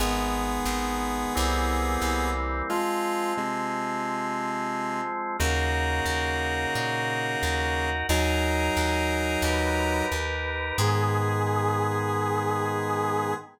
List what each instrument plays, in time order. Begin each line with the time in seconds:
0.00 electric bass (finger) G#1, drawbar organ D#3 G#3 B3, lead 1 (square) B3 G#4
0.65 electric bass (finger) G#1
1.35 electric bass (finger) C2, drawbar organ E3 G3 A#3 C4
2.02 electric bass (finger) C2
2.70 drawbar organ F3 G#3 C4, lead 1 (square) G#3 F4
3.37 lead 1 (square) C3 G#3
5.39 electric bass (finger) D#2, lead 1 (square) C#3 A#3, drawbar organ D#4 F#4 A#4
6.06 electric bass (finger) D#2
6.75 electric bass (finger) A#2
7.43 electric bass (finger) D#2
8.09 electric bass (finger) D#2, lead 1 (square) F#3 D#4, drawbar organ D#4 G#4 A#4
8.77 electric bass (finger) D#2
9.42 electric bass (finger) D#2, drawbar organ D#4 G4 A#4, brass section B4
10.12 electric bass (finger) D#2
10.78 electric bass (finger) G#2, drawbar organ D#3 G#3 B3, lead 1 (square) G#4, brass section G#4